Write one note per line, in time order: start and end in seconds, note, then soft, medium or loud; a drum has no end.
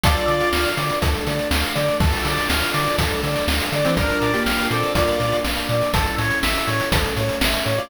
0.03 0.17 D2 loud
0.03 1.02 D4 medium
0.03 0.68 F4 loud
0.03 1.02 F4 loud
0.03 0.26 A4 loud
0.03 1.02 A4 medium
0.03 0.68 D5 loud
0.03 kick loud
0.03 closed hi-hat loud
0.16 closed hi-hat medium
0.27 0.42 D3 medium
0.27 0.49 D5 medium
0.27 closed hi-hat medium
0.40 closed hi-hat medium
0.53 0.66 D2 medium
0.53 0.75 F5 medium
0.53 snare loud
0.65 closed hi-hat medium
0.77 0.91 D3 loud
0.77 0.99 D5 medium
0.77 closed hi-hat loud
0.90 closed hi-hat medium
1.02 1.16 D2 medium
1.02 2.01 A3 medium
1.02 2.01 D4 loud
1.02 1.24 A4 medium
1.02 2.01 A4 medium
1.02 kick loud
1.02 closed hi-hat loud
1.14 closed hi-hat medium
1.26 1.40 D3 medium
1.26 1.49 D5 medium
1.26 closed hi-hat medium
1.39 closed hi-hat medium
1.51 1.64 D2 loud
1.51 1.73 F5 medium
1.51 snare loud
1.63 closed hi-hat medium
1.75 1.90 D3 medium
1.75 1.97 D5 medium
1.75 closed hi-hat medium
1.88 closed hi-hat medium
2.00 2.14 D2 loud
2.00 2.99 D4 medium
2.00 2.99 F4 medium
2.00 2.23 A4 loud
2.00 2.99 A4 loud
2.00 kick loud
2.00 crash loud
2.13 closed hi-hat medium
2.25 2.38 D3 medium
2.25 2.48 D5 medium
2.25 closed hi-hat loud
2.37 closed hi-hat medium
2.50 2.63 D2 medium
2.50 2.72 F5 medium
2.50 snare loud
2.62 closed hi-hat medium
2.74 2.88 D3 loud
2.74 2.96 D5 medium
2.74 closed hi-hat loud
2.86 closed hi-hat medium
2.98 3.12 D2 medium
2.98 3.97 A3 medium
2.98 3.97 D4 medium
2.98 3.22 A4 medium
2.98 3.97 A4 loud
2.98 kick loud
2.98 closed hi-hat loud
3.11 closed hi-hat medium
3.23 3.37 D3 medium
3.23 3.46 D5 medium
3.23 closed hi-hat medium
3.36 closed hi-hat medium
3.48 3.61 D2 medium
3.48 3.70 F5 medium
3.48 snare loud
3.60 closed hi-hat loud
3.72 3.86 D3 medium
3.72 3.95 D5 medium
3.72 closed hi-hat medium
3.85 3.96 E3 medium
3.85 3.96 C4 loud
3.85 closed hi-hat medium
3.97 4.10 A#1 loud
3.97 4.31 D4 medium
3.97 4.93 D4 loud
3.97 4.95 F4 loud
3.97 4.31 A#4 loud
3.97 4.20 A#4 loud
3.97 4.93 A#4 loud
3.97 kick loud
3.97 closed hi-hat loud
4.09 closed hi-hat medium
4.21 4.35 A#2 medium
4.21 4.43 D5 medium
4.21 closed hi-hat medium
4.33 4.68 A#3 medium
4.33 4.68 G4 loud
4.33 closed hi-hat medium
4.46 4.60 A#1 medium
4.46 4.68 F5 medium
4.46 snare loud
4.59 closed hi-hat medium
4.71 4.84 A#2 medium
4.71 4.92 C4 medium
4.71 4.92 A4 medium
4.71 4.93 D5 medium
4.71 closed hi-hat medium
4.83 closed hi-hat medium
4.94 5.09 A#1 medium
4.94 5.91 A#3 medium
4.94 5.91 D4 loud
4.94 5.36 F4 medium
4.94 5.91 A#4 medium
4.94 5.17 A#4 medium
4.94 5.36 D5 loud
4.94 kick loud
4.94 closed hi-hat loud
5.08 closed hi-hat medium
5.20 5.34 A#2 loud
5.20 5.43 D5 medium
5.20 closed hi-hat medium
5.32 closed hi-hat medium
5.44 5.58 A#1 medium
5.44 5.66 F5 medium
5.44 snare loud
5.57 closed hi-hat medium
5.69 5.83 A#2 loud
5.69 5.92 D5 medium
5.69 closed hi-hat medium
5.82 closed hi-hat medium
5.94 6.07 A1 loud
5.94 6.91 C#4 loud
5.94 6.92 E4 loud
5.94 6.16 A4 loud
5.94 6.91 A4 medium
5.94 kick loud
5.94 closed hi-hat loud
6.06 closed hi-hat medium
6.18 6.32 A2 loud
6.18 6.40 C#5 medium
6.18 closed hi-hat medium
6.31 closed hi-hat medium
6.43 6.57 A1 medium
6.43 6.65 E5 medium
6.43 snare loud
6.55 closed hi-hat medium
6.67 6.81 A2 medium
6.67 6.89 C#5 medium
6.67 closed hi-hat medium
6.80 closed hi-hat medium
6.92 7.05 A1 loud
6.92 7.89 A3 medium
6.92 7.89 C#4 loud
6.92 7.89 A4 medium
6.92 7.15 A4 medium
6.92 kick loud
6.92 closed hi-hat loud
7.05 closed hi-hat medium
7.16 7.31 A2 loud
7.16 7.38 C#5 medium
7.16 closed hi-hat medium
7.29 closed hi-hat medium
7.41 7.55 A1 medium
7.41 7.64 E5 medium
7.41 snare loud
7.54 closed hi-hat medium
7.65 7.80 A2 medium
7.65 7.87 C#5 medium
7.65 closed hi-hat medium
7.78 7.89 F4 medium
7.78 7.89 D5 loud
7.78 closed hi-hat medium